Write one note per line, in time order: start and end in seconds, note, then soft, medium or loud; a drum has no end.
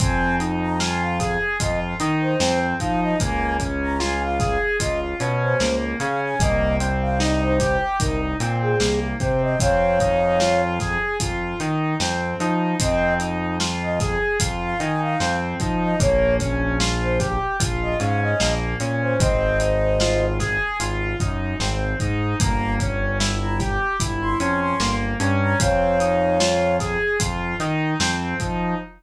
0.00 1.37 F2 medium
0.00 0.36 C4 medium
0.00 0.35 G#5 medium
0.00 kick loud
0.00 closed hi-hat loud
0.40 0.76 D#4 medium
0.40 closed hi-hat medium
0.61 0.79 A#5 medium
0.80 1.16 F4 medium
0.80 1.01 G#5 medium
0.80 snare loud
1.01 1.35 F5 medium
1.20 1.56 G#4 medium
1.20 kick medium
1.20 snare medium
1.20 closed hi-hat medium
1.60 1.95 F2 medium
1.60 1.96 F4 medium
1.60 1.80 D#5 medium
1.60 kick loud
1.60 closed hi-hat loud
2.00 2.34 D#3 medium
2.00 2.37 D#4 medium
2.00 closed hi-hat medium
2.21 2.58 C5 medium
2.40 2.74 F2 medium
2.40 2.76 C4 medium
2.40 snare loud
2.80 3.15 F3 medium
2.80 3.16 D#4 medium
2.80 3.01 F5 medium
2.80 kick medium
2.80 closed hi-hat medium
3.02 3.19 D#5 medium
3.20 4.58 C#2 medium
3.20 3.57 A#3 medium
3.20 3.55 G#5 medium
3.20 kick loud
3.20 closed hi-hat loud
3.60 3.96 C#4 medium
3.60 kick medium
3.60 closed hi-hat medium
3.82 4.00 A#5 medium
4.00 4.36 F4 medium
4.00 4.21 G#5 medium
4.00 snare loud
4.23 4.58 F5 medium
4.40 4.76 G#4 medium
4.40 kick loud
4.40 snare medium
4.40 closed hi-hat medium
4.80 5.15 C#2 medium
4.80 5.16 F4 medium
4.80 5.00 D#5 medium
4.80 kick medium
4.80 closed hi-hat loud
5.20 5.55 B2 medium
5.20 5.56 C#4 medium
5.20 closed hi-hat medium
5.42 5.76 C5 medium
5.60 5.95 C#2 medium
5.60 5.96 A#3 medium
5.60 snare loud
6.00 6.35 C#3 medium
6.00 6.36 C#4 medium
6.00 6.21 F5 medium
6.00 closed hi-hat medium
6.23 6.40 G#5 medium
6.40 7.77 C2 medium
6.40 6.77 A#3 medium
6.40 6.76 D#5 loud
6.40 kick loud
6.40 closed hi-hat loud
6.80 7.17 C4 medium
6.80 closed hi-hat medium
7.01 7.19 F5 medium
7.20 7.56 D#4 medium
7.20 7.41 D#5 medium
7.20 snare loud
7.42 7.76 C5 medium
7.60 7.96 G4 medium
7.60 kick medium
7.60 snare medium
7.60 closed hi-hat medium
8.00 8.35 C2 medium
8.00 8.36 D#4 medium
8.00 8.20 A#4 medium
8.00 kick loud
8.00 closed hi-hat loud
8.40 8.75 A#2 medium
8.40 8.77 C4 medium
8.40 closed hi-hat medium
8.62 9.00 G#4 medium
8.80 9.14 C2 medium
8.80 9.16 A#3 medium
8.80 snare loud
9.20 9.55 C3 medium
9.20 9.57 C4 medium
9.20 9.41 C5 medium
9.20 kick loud
9.20 closed hi-hat medium
9.42 9.59 D#5 medium
9.60 10.97 F2 medium
9.60 9.96 C4 medium
9.60 10.62 C#5 medium
9.60 10.62 F5 loud
9.60 kick loud
9.60 closed hi-hat loud
10.00 10.37 D#4 medium
10.00 kick medium
10.00 closed hi-hat medium
10.40 10.76 F4 medium
10.40 snare loud
10.80 11.16 G#4 medium
10.80 kick medium
10.80 snare medium
10.80 closed hi-hat medium
11.20 11.54 F2 medium
11.20 11.57 F4 medium
11.20 kick medium
11.20 closed hi-hat loud
11.60 11.95 D#3 medium
11.60 11.96 D#4 medium
11.60 closed hi-hat medium
12.00 12.34 F2 medium
12.00 12.36 C4 medium
12.00 snare loud
12.40 12.75 F3 medium
12.40 12.77 D#4 medium
12.40 closed hi-hat medium
12.80 14.17 F2 medium
12.80 13.16 C4 medium
12.80 13.14 D#5 loud
12.80 kick loud
12.80 closed hi-hat loud
13.20 13.56 D#4 medium
13.20 closed hi-hat medium
13.60 13.97 F4 medium
13.60 snare loud
13.82 13.99 D#5 medium
14.00 14.37 G#4 medium
14.00 kick loud
14.00 snare medium
14.00 closed hi-hat medium
14.40 14.75 F2 medium
14.40 14.77 F4 medium
14.40 kick loud
14.40 closed hi-hat loud
14.63 14.80 F5 medium
14.79 15.15 D#3 medium
14.79 15.16 D#4 medium
14.79 15.00 G#5 medium
14.79 closed hi-hat medium
15.02 15.36 F5 medium
15.20 15.55 F2 medium
15.20 15.57 C4 medium
15.20 snare loud
15.60 15.95 F3 medium
15.60 15.97 D#4 medium
15.60 kick loud
15.60 closed hi-hat medium
15.82 16.00 D#5 medium
16.00 17.37 A#1 medium
16.00 16.36 A#3 medium
16.00 16.35 C#5 loud
16.00 kick loud
16.00 closed hi-hat loud
16.40 16.76 C#4 medium
16.40 kick loud
16.40 closed hi-hat medium
16.80 17.16 F4 medium
16.80 snare loud
17.01 17.18 C5 medium
17.20 17.56 G4 medium
17.20 kick medium
17.20 snare medium
17.20 closed hi-hat medium
17.60 17.95 A#1 medium
17.60 17.96 F4 medium
17.60 kick loud
17.60 closed hi-hat loud
17.82 17.99 D#5 medium
18.00 18.34 G#2 medium
18.00 18.36 C#4 medium
18.00 18.21 F5 medium
18.00 closed hi-hat medium
18.21 18.54 D#5 medium
18.40 18.75 A#1 medium
18.40 18.77 A#3 medium
18.40 snare loud
18.80 19.15 A#2 medium
18.80 19.17 C#4 medium
18.80 closed hi-hat medium
19.01 19.18 C5 medium
19.20 20.57 G#1 medium
19.20 19.56 C4 medium
19.20 20.26 C5 medium
19.20 20.26 D#5 medium
19.20 kick loud
19.20 closed hi-hat loud
19.60 19.96 D#4 medium
19.60 closed hi-hat medium
20.00 20.37 F4 medium
20.00 snare loud
20.40 20.76 G#4 medium
20.40 kick medium
20.40 snare medium
20.40 closed hi-hat medium
20.80 21.15 G#1 medium
20.80 21.16 F4 medium
20.80 closed hi-hat loud
21.20 21.54 F#2 medium
21.20 21.56 D#4 medium
21.20 kick loud
21.20 closed hi-hat medium
21.60 21.94 G#1 medium
21.60 21.96 C4 medium
21.60 snare loud
22.00 22.35 G#2 medium
22.00 22.36 D#4 medium
22.00 kick medium
22.00 closed hi-hat medium
22.40 23.77 G1 medium
22.40 22.76 A#3 medium
22.40 22.74 A#5 medium
22.40 kick loud
22.40 closed hi-hat loud
22.80 23.16 C#4 medium
22.80 kick loud
22.80 closed hi-hat medium
23.20 23.56 E4 medium
23.20 snare loud
23.41 23.59 A#5 medium
23.60 23.96 G4 medium
23.60 kick medium
23.60 snare medium
23.60 closed hi-hat medium
24.00 24.35 G1 medium
24.00 24.36 E4 medium
24.00 kick loud
24.00 closed hi-hat loud
24.22 24.39 C6 medium
24.39 24.74 F2 medium
24.39 24.76 C#4 medium
24.39 24.60 C6 medium
24.39 closed hi-hat medium
24.61 24.95 C6 medium
24.80 25.15 G1 medium
24.80 25.17 A#3 medium
24.80 snare loud
25.20 25.55 G2 medium
25.20 25.56 C#4 medium
25.20 closed hi-hat medium
25.42 25.59 A#5 medium
25.60 26.97 F2 medium
25.60 25.96 C4 medium
25.60 26.77 C#5 medium
25.60 26.77 F5 medium
25.60 kick loud
25.60 closed hi-hat loud
26.00 26.36 D#4 medium
26.00 closed hi-hat medium
26.40 26.76 F4 medium
26.40 snare loud
26.80 27.17 G#4 medium
26.80 kick medium
26.80 snare medium
26.80 closed hi-hat medium
27.20 27.54 F2 medium
27.20 27.56 F4 medium
27.20 kick loud
27.20 closed hi-hat loud
27.60 27.94 D#3 medium
27.60 27.97 D#4 medium
27.60 snare soft
27.60 closed hi-hat medium
28.00 28.35 F2 medium
28.00 28.36 C4 medium
28.00 snare loud
28.40 28.75 F3 medium
28.40 28.76 D#4 medium
28.40 kick medium
28.40 closed hi-hat medium